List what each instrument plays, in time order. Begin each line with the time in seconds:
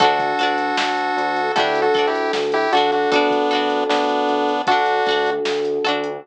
0.00 synth bass 1 D2, electric piano 1 D4 F#4 A4, lead 1 (square) F#4 A4, pizzicato strings F#4 A4, kick, closed hi-hat
0.04 pizzicato strings D4
0.19 kick, closed hi-hat
0.39 synth bass 1 D2, pizzicato strings F#4 A4, closed hi-hat
0.43 pizzicato strings D4
0.58 closed hi-hat
0.77 synth bass 1 D2, snare
0.97 closed hi-hat
1.17 synth bass 1 D2, closed hi-hat
1.36 closed hi-hat
1.56 synth bass 1 D2, electric piano 1 D4 F#4 A4, pizzicato strings D4 F#4 A4, lead 1 (square) E4 G4, kick, closed hi-hat
1.75 closed hi-hat
1.82 lead 1 (square) F#4 A4
1.94 synth bass 1 D2, pizzicato strings F#4 A4, kick, closed hi-hat
1.99 pizzicato strings D4
2.07 lead 1 (square) E4 G4
2.15 closed hi-hat
2.33 synth bass 1 D2, snare
2.52 lead 1 (square) E4 G4, closed hi-hat
2.72 synth bass 1 D2, lead 1 (square) D4 F#4, electric piano 1 D4 F#4 A4, pizzicato strings F#4 A4, closed hi-hat
2.77 pizzicato strings D4
2.92 lead 1 (square) D4 F#4, closed hi-hat
3.12 synth bass 1 D2, lead 1 (square) B3 D4, pizzicato strings F#4 A4, kick, closed hi-hat
3.16 pizzicato strings D4
3.31 kick, closed hi-hat
3.51 synth bass 1 D2, pizzicato strings D4 F#4 A4, closed hi-hat
3.70 closed hi-hat
3.89 synth bass 1 D2, lead 1 (square) B3 D4, snare
4.09 closed hi-hat
4.29 synth bass 1 D2, closed hi-hat
4.49 closed hi-hat
4.67 synth bass 1 D2, lead 1 (square) D4 F#4, electric piano 1 D4 F#4 A4, pizzicato strings F#4 A4, kick, closed hi-hat
4.71 pizzicato strings D4
4.86 closed hi-hat
5.06 synth bass 1 D2, pizzicato strings F#4 A4, kick, closed hi-hat
5.11 pizzicato strings D4
5.26 closed hi-hat
5.45 synth bass 1 D2, snare
5.65 closed hi-hat
5.84 synth bass 1 D2, pizzicato strings F#4 A4, closed hi-hat
5.88 pizzicato strings D4
6.04 closed hi-hat